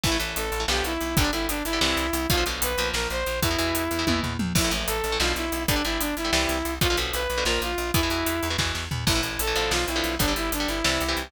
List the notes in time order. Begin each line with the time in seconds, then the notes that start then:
0.03 A1 E3 A3 E4, kick, crash
0.12 E3 A3
0.19 A1 E3 A3, closed hi-hat
0.36 A1 A4, closed hi-hat
0.52 A1, closed hi-hat
0.60 E3 A3
0.68 B1 D3 F3 B3 G4, snare
0.84 B1 E4, closed hi-hat
1.01 B1, closed hi-hat
1.17 G1 D3 G3 D4, kick, closed hi-hat
1.24 D3 G3
1.32 G1 D3 G3 E4, closed hi-hat
1.49 G1 D4, closed hi-hat
1.64 G1 E4, closed hi-hat
1.73 D3 G3
1.81 C2 C3 E3 G3, snare
1.97 C2, closed hi-hat
2.13 C2, closed hi-hat
2.30 B1 B2 D3 F3 F4, kick, closed hi-hat
2.37 B2 D3 F3
2.46 B1 B2 D3 F3, closed hi-hat
2.62 B1 B4, closed hi-hat
2.77 B1 A#2 F3, closed hi-hat
2.94 A#1 A#4, snare
3.10 A#1 C5, closed hi-hat
3.26 A#1, closed hi-hat
3.42 E2 B2 E3 E4, kick, closed hi-hat
3.51 B2 E3
3.58 E2 B2 E3, closed hi-hat
3.75 E2, closed hi-hat
3.91 E2, closed hi-hat
3.99 B2 E3
4.07 E2 B2 E3, kick, high tom
4.23 E2, floor tom
4.39 E2, mid tom
4.55 A1 A2 E3 E4, kick, crash
4.64 A2 E3
4.71 A1 A2 E3, closed hi-hat
4.87 A1 A4, closed hi-hat
5.04 A1, closed hi-hat
5.12 A2 E3
5.20 B1 B2 D3 F3 F4, snare
5.36 B1 E4, closed hi-hat
5.52 B1, closed hi-hat
5.68 G1 D3 G3 D4, kick, closed hi-hat
5.76 D3 G3
5.84 G1 D3 G3 E4, closed hi-hat
6.00 G1 D4, closed hi-hat
6.16 G1 E4, closed hi-hat
6.25 D3 G3
6.33 C2 C3 E3 G3, snare
6.49 C2, closed hi-hat
6.65 C2, closed hi-hat
6.81 B1 B2 D3 F3 F4, kick, closed hi-hat
6.90 B2 D3 F3
6.97 B1 B2 D3 F3, closed hi-hat
7.14 B1 B4, closed hi-hat
7.30 B1, closed hi-hat
7.38 B2 D3 F3
7.45 A#1 A#2 F3 A#4, snare
7.61 A#1 F4, closed hi-hat
7.78 A#1, closed hi-hat
7.94 E2 B2 E3 E4, kick, closed hi-hat
8.03 B2 E3
8.10 E2 B2 E3, closed hi-hat
8.26 E2, closed hi-hat
8.43 E2, closed hi-hat
8.50 B2 E3
8.58 E2 B2 E3, kick, snare
8.75 E2, snare
8.91 E2, floor tom
9.07 A1 A2 E3 E4, kick, crash
9.15 A2 E3
9.23 A1, closed hi-hat
9.39 A1 A4, closed hi-hat
9.47 A2 E3
9.55 A1 B2 D3 F3, closed hi-hat
9.71 B1 F4, snare
9.88 B1 E4, closed hi-hat
9.96 B2 D3 F3
10.04 B1, closed hi-hat
10.19 G1 D3 G3 D4, kick, closed hi-hat
10.28 D3 G3
10.36 G1 E4, closed hi-hat
10.52 G1 D4, closed hi-hat
10.60 D3 G3
10.68 G1 E4, closed hi-hat
10.84 C2 C3 E3 G3, snare
11.01 C2, closed hi-hat
11.09 C3 E3 G3
11.17 C2, closed hi-hat